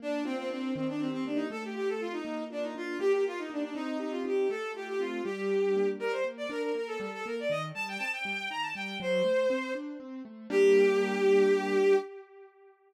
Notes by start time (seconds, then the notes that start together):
0.00 A#3 D4
0.24 C4 F4
0.37 C4
0.49 C4 D4
0.75 D#3 C4
0.88 D4
0.99 C4 G4
1.12 C4
1.25 A#3 D4
1.36 D#4
1.50 A3 A4
1.64 G4
1.75 F4 G4
1.89 A4
1.99 C4 F4
2.12 D#4
2.25 A#3
2.50 D4 F4
2.62 D#4
2.75 D4 F4
2.99 A#3 G4
3.12 G4
3.25 F4 G4
3.38 D#4
3.50 D4 D#4
3.63 D4
3.74 C4 D#4
4.00 D#4 G4
4.11 F4
4.24 D#4 G4
4.50 A3 A4
4.75 F4 G4
4.88 G4
4.99 C4 F4
5.24 G3 G4
5.50 D4
5.76 A#3
5.99 G3 A#4
6.12 C5
6.24 A#3
6.37 D5
6.49 D4 A#4
6.62 A#4
6.75 A#3 A#4
6.87 A4
6.99 G3 A4
7.13 A4
7.26 A#3 A#4
7.39 D5
7.50 D#3 D#5
7.74 G3 A5
7.88 G5
7.98 C4 A5
8.12 G5
8.25 G3
8.50 D#3 A#5
8.62 A5
8.75 G3 G5
9.00 F#3 C5
9.24 A3
9.50 C4
9.75 D4
10.00 C4
10.25 A3
10.50 G3 A#3 D4 G4